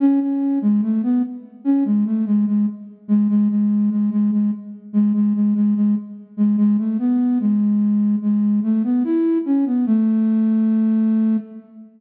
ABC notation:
X:1
M:4/4
L:1/16
Q:1/4=73
K:A
V:1 name="Flute"
C C2 G, A, B, z2 C G, A, G, G, z2 G, | G, G,2 G, G, G, z2 G, G, G, G, G, z2 G, | G, A, B,2 G,4 G,2 A, B, E2 C B, | A,8 z8 |]